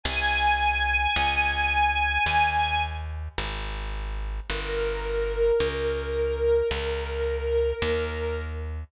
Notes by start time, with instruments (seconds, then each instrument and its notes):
0.03 electric bass (finger) C2, string ensemble 1 G#5
1.16 electric bass (finger) C#2
2.26 electric bass (finger) D#2
3.38 electric bass (finger) G#1
4.48 electric bass (finger) G1, string ensemble 1 A#4
5.60 electric bass (finger) C#2
6.71 electric bass (finger) C#2
7.82 electric bass (finger) D#2